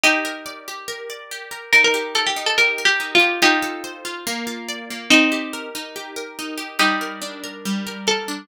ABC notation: X:1
M:4/4
L:1/16
Q:1/4=142
K:Gm
V:1 name="Pizzicato Strings"
[EG]12 z4 | B B3 A G2 A (3B4 G4 F4 | [EG]12 z4 | [CE]6 z10 |
[EG]12 A4 |]
V:2 name="Acoustic Guitar (steel)"
G2 B2 d2 G2 B2 d2 G2 B2 | E2 G2 B2 E2 G2 B2 E2 G2 | F2 A2 c2 F2 B,2 F2 d2 B,2 | E2 G2 B2 E2 G2 B2 E2 G2 |
G,2 B2 D2 B2 G,2 B2 B2 D2 |]